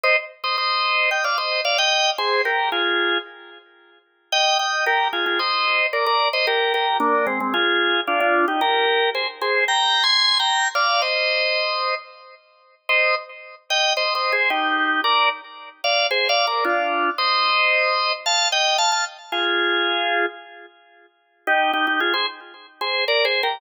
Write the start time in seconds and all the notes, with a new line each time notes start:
0.03 C5 D#5
0.44 C5 D#5
0.58 C5 D#5
1.11 D#5 G5
1.24 D5 F5
1.38 C5 D#5
1.65 D5 F5
1.78 D#5 G5
2.18 G#4 C5
2.45 G4 A#4
2.72 F4 G#4
4.32 D#5 G5
4.59 D#5 G5
4.86 G4 A#4
5.13 F4 G#4
5.26 F4 G#4
5.39 C5 D#5
5.93 A#4 D5
6.06 A#4 D5
6.33 C5 D#5
6.47 G4 A#4
6.74 G4 A#4
7.00 A#3 D4
7.27 G#3 C4
7.40 G#3 C4
7.54 F4 G#4
8.07 D4 F4
8.20 D4 F4
8.48 D#4 G4
8.61 G4 A#4
9.15 G#4 C5
9.41 G#4 C5
9.68 G5 A#5
10.03 G#5 C6
10.39 G5 A#5
10.75 D5 F5
11.02 C5 D#5
12.89 C5 D#5
13.70 D#5 G5
13.97 C5 D#5
14.15 C5 D#5
14.32 G#4 C5
14.50 D#4 G4
15.04 A#4 D5
15.84 D5 F5
16.11 G#4 C5
16.29 D5 F5
16.47 A#4 D5
16.65 D4 F4
17.18 C5 D#5
18.26 F5 A5
18.52 D#5 G5
18.78 F5 A5
18.92 F5 A5
19.32 F4 G#4
21.47 D#4 G4
21.73 D#4 G4
21.87 D#4 G4
22.00 F4 G#4
22.14 G#4 C5
22.81 G#4 C5
23.08 A#4 D5
23.25 G#4 C5
23.43 G4 A#4